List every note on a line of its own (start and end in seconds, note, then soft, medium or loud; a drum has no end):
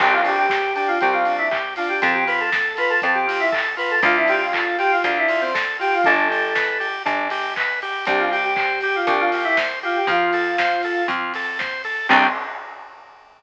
0.00 0.91 C2 medium
0.00 0.22 C4 medium
0.00 0.13 G4 loud
0.00 kick loud
0.00 crash loud
0.13 0.25 F4 medium
0.24 0.47 D4 medium
0.24 0.37 G4 loud
0.24 open hi-hat medium
0.38 0.72 G4 loud
0.50 0.73 G4 medium
0.50 kick medium
0.50 snare loud
0.75 0.98 D4 medium
0.75 0.87 G4 loud
0.75 open hi-hat medium
0.88 1.00 F4 loud
1.01 1.95 C2 medium
1.01 1.24 C4 medium
1.01 1.13 G4 loud
1.01 kick medium
1.01 closed hi-hat medium
1.13 1.33 F4 loud
1.25 1.49 D4 medium
1.25 open hi-hat medium
1.38 1.50 E4 loud
1.51 1.74 G4 medium
1.51 kick medium
1.51 clap medium
1.76 2.01 D4 medium
1.76 1.88 F4 medium
1.76 open hi-hat medium
1.89 2.01 G4 medium
2.02 2.96 F2 medium
2.02 2.24 C4 medium
2.02 2.14 A4 loud
2.02 kick loud
2.02 closed hi-hat loud
2.13 2.25 G4 loud
2.27 2.50 F4 medium
2.27 2.39 B4 loud
2.27 open hi-hat medium
2.40 2.76 A4 medium
2.52 2.75 A4 medium
2.52 kick medium
2.52 snare loud
2.77 3.01 F4 medium
2.77 2.90 B4 loud
2.77 open hi-hat medium
2.90 3.02 A4 loud
3.02 3.96 F2 medium
3.02 3.26 C4 medium
3.02 3.15 A4 medium
3.02 kick medium
3.02 closed hi-hat medium
3.14 3.39 G4 loud
3.27 3.50 F4 medium
3.27 open hi-hat medium
3.39 3.51 E4 loud
3.52 3.75 A4 medium
3.52 kick medium
3.52 clap loud
3.77 4.00 F4 medium
3.77 3.90 B4 loud
3.77 open hi-hat medium
3.90 4.02 A4 loud
4.02 4.96 D2 medium
4.02 4.25 D4 medium
4.02 4.15 F4 loud
4.02 kick loud
4.02 closed hi-hat loud
4.17 4.29 E4 loud
4.28 4.52 F4 medium
4.28 4.40 G4 loud
4.28 open hi-hat medium
4.42 4.75 F4 medium
4.53 4.77 A4 medium
4.53 kick medium
4.53 clap loud
4.78 5.02 F4 medium
4.78 4.90 G4 loud
4.78 open hi-hat medium
4.92 5.03 F4 loud
5.04 5.97 D2 medium
5.04 5.27 D4 medium
5.04 5.16 F4 medium
5.04 kick medium
5.04 closed hi-hat loud
5.17 5.40 E4 medium
5.29 5.52 F4 medium
5.29 open hi-hat medium
5.41 5.53 C4 loud
5.54 5.77 A4 medium
5.54 kick medium
5.54 snare loud
5.79 6.02 F4 medium
5.79 5.92 G4 loud
5.79 open hi-hat medium
5.93 6.05 F4 loud
6.04 6.99 G1 medium
6.04 6.28 D4 loud
6.04 6.86 A4 loud
6.04 kick medium
6.04 closed hi-hat medium
6.30 6.53 G4 medium
6.30 open hi-hat medium
6.55 6.78 B4 medium
6.55 kick medium
6.55 snare loud
6.80 7.03 G4 medium
6.80 open hi-hat medium
7.05 7.99 G1 medium
7.05 7.28 D4 medium
7.05 kick medium
7.05 closed hi-hat loud
7.30 7.54 G4 medium
7.30 open hi-hat medium
7.56 7.80 B4 medium
7.56 kick medium
7.56 clap loud
7.82 8.05 G4 medium
7.82 open hi-hat medium
8.05 9.00 C2 medium
8.05 8.29 D4 medium
8.05 8.20 G4 loud
8.05 kick loud
8.05 closed hi-hat loud
8.19 8.31 F4 medium
8.31 8.54 G4 medium
8.31 8.43 G4 loud
8.31 open hi-hat medium
8.45 8.80 G4 loud
8.56 8.79 C5 medium
8.56 kick medium
8.56 clap loud
8.81 8.94 G4 loud
8.81 9.06 G4 medium
8.81 open hi-hat medium
8.96 9.08 F4 loud
9.07 10.00 C2 medium
9.07 9.30 D4 medium
9.07 9.20 G4 medium
9.07 kick medium
9.07 closed hi-hat loud
9.20 9.43 F4 loud
9.32 9.56 G4 medium
9.32 open hi-hat medium
9.44 9.56 E4 loud
9.57 9.79 C5 medium
9.57 kick medium
9.57 snare loud
9.83 9.96 F4 loud
9.83 10.06 G4 medium
9.83 open hi-hat medium
9.96 10.08 G4 loud
10.07 11.00 F2 medium
10.07 10.31 F4 medium
10.07 11.02 F4 loud
10.07 kick loud
10.07 closed hi-hat loud
10.33 10.56 A4 medium
10.33 open hi-hat medium
10.58 10.82 C5 medium
10.58 kick medium
10.58 snare loud
10.83 11.07 A4 medium
10.83 open hi-hat medium
11.08 12.01 F2 medium
11.08 11.33 F4 medium
11.08 kick medium
11.08 closed hi-hat medium
11.34 11.58 A4 medium
11.34 open hi-hat medium
11.59 11.82 C5 medium
11.59 kick medium
11.59 snare medium
11.84 12.07 A4 medium
11.84 open hi-hat medium
12.09 12.28 C2 loud
12.09 12.27 C4 loud
12.09 12.28 C4 loud
12.09 12.27 D4 loud
12.09 12.27 G4 loud
12.09 kick loud
12.09 crash loud